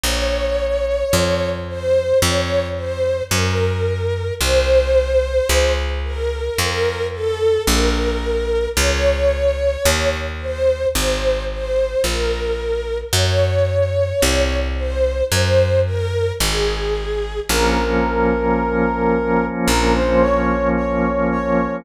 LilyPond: <<
  \new Staff \with { instrumentName = "Brass Section" } { \time 4/4 \key bes \minor \tempo 4 = 55 r1 | r1 | r1 | r1 |
bes'2 bes'16 c''16 des''8 des''8 des''8 | }
  \new Staff \with { instrumentName = "String Ensemble 1" } { \time 4/4 \key bes \minor des''4. c''8 des''8 c''8 bes'4 | c''4. bes'8 bes'8 a'8 bes'4 | des''4. c''8 c''8 c''8 bes'4 | des''4. c''8 c''8 bes'8 aes'4 |
r1 | }
  \new Staff \with { instrumentName = "Drawbar Organ" } { \time 4/4 \key bes \minor r1 | r1 | r1 | r1 |
<f bes des'>1 | }
  \new Staff \with { instrumentName = "Electric Bass (finger)" } { \clef bass \time 4/4 \key bes \minor bes,,4 f,4 f,4 ges,4 | c,4 des,4 f,4 bes,,4 | des,4 ees,4 aes,,4 bes,,4 | ges,4 c,4 ges,4 aes,,4 |
bes,,2 bes,,2 | }
>>